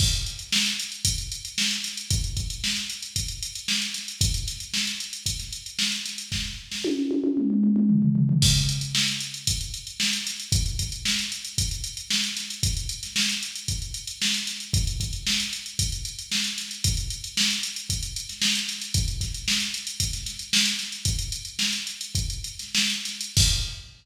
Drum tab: CC |x---------------|----------------|----------------|----------------|
HH |-xxx-xxxxxxx-xxx|xxxx-xxxxxxx-xxx|xxxx-xxxxxxx-xxx|----------------|
SD |----o-------o-o-|----o-------o-o-|--o-o----o--ooo-|o--o------------|
T1 |----------------|----------------|----------------|----o-oo--------|
T2 |----------------|----------------|----------------|--------oooo----|
FT |----------------|----------------|----------------|------------oooo|
BD |o-------o-------|o-o-----o-------|o-------o-------|o---------------|

CC |x---------------|----------------|----------------|----------------|
HH |-xxx-xxxxxxx-xxx|xxxx-xxxxxxx-xxx|xxxx-xxxxxxx-xxx|xxxx-xxxxxxx-xxx|
SD |----oo------o-o-|----o-------o-o-|---ooo------o-o-|----o-------o-o-|
T1 |----------------|----------------|----------------|----------------|
T2 |----------------|----------------|----------------|----------------|
FT |----------------|----------------|----------------|----------------|
BD |o-------o-------|o-o-----o-------|o-------o-------|o-o-----o-------|

CC |----------------|----------------|----------------|x---------------|
HH |xxxx-xxxxxxx-xxx|xxxx-xxxxxxx-xxx|xxxx-xxxxxxx-xxx|----------------|
SD |----oo-----oo-oo|--o-oo---oo-o-oo|----oo-----oooo-|----------------|
T1 |----------------|----------------|----------------|----------------|
T2 |----------------|----------------|----------------|----------------|
FT |----------------|----------------|----------------|----------------|
BD |o-------o-------|o-o-----o-------|o-------o-------|o---------------|